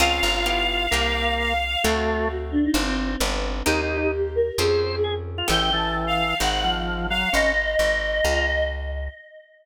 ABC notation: X:1
M:4/4
L:1/16
Q:1/4=131
K:Dblyd
V:1 name="Choir Aahs"
f12 f4 | ^F6 =D E C4 z4 | G6 B2 A4 z4 | g g =a2 z f3 _g3 z3 f2 |
e12 z4 |]
V:2 name="Drawbar Organ"
F6 F2 B,6 z2 | =A,4 z12 | (3E2 E2 E2 z4 c4 A z2 F | =E,2 E,6 z2 F,4 _G,2 |
D2 z6 F2 z6 |]
V:3 name="Acoustic Guitar (steel)"
[CDFA]4 [=B,=EFG]4 [_B,C_EG]8 | [=A,C=D^F]8 [CD=FG]4 [=B,DFG]4 | [B,CEG]8 [CDFA]8 | [=B,^CG=A]8 [=CE_G_A]8 |
z16 |]
V:4 name="Electric Bass (finger)" clef=bass
D,,2 G,,,6 C,,8 | =D,,8 G,,,4 G,,,4 | E,,8 F,,8 | =A,,,8 _A,,,8 |
A,,,4 A,,,4 D,,8 |]